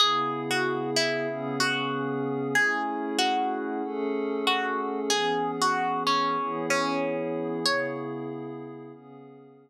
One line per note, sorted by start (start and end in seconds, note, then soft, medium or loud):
0.00 1.27 C#3 medium
0.00 1.27 B3 medium
0.00 1.27 E4 medium
0.00 0.44 G#4 medium
0.00 1.27 G#4 loud
0.51 0.90 F#4 medium
0.96 1.56 E4 medium
1.28 2.55 C#3 medium
1.28 2.55 B3 medium
1.28 2.55 C#4 medium
1.28 2.55 G#4 medium
1.60 2.47 F#4 medium
2.55 3.82 A3 medium
2.55 3.82 C#4 medium
2.55 3.82 E4 medium
2.55 3.17 G#4 medium
2.55 3.82 G#4 medium
3.19 4.32 F#4 medium
3.83 5.10 A3 medium
3.83 5.09 C#4 medium
3.83 5.09 G#4 medium
3.83 5.10 A4 medium
4.47 5.00 F#4 medium
5.10 6.37 E3 medium
5.10 6.37 B3 medium
5.10 6.37 C#4 medium
5.10 5.51 G#4 medium
5.10 6.37 G#4 medium
5.62 6.03 F#4 medium
6.07 6.66 C#4 medium
6.38 7.65 E3 medium
6.38 7.65 B3 medium
6.38 7.65 E4 medium
6.38 7.65 G#4 medium
6.70 7.60 C#4 medium
7.65 8.92 C#3 medium
7.65 8.92 B3 medium
7.65 8.92 E4 medium
7.65 8.92 G#4 medium
7.65 8.47 C#5 medium
8.93 9.70 C#3 medium
8.93 9.70 B3 medium
8.93 9.70 C#4 medium
8.93 9.70 G#4 medium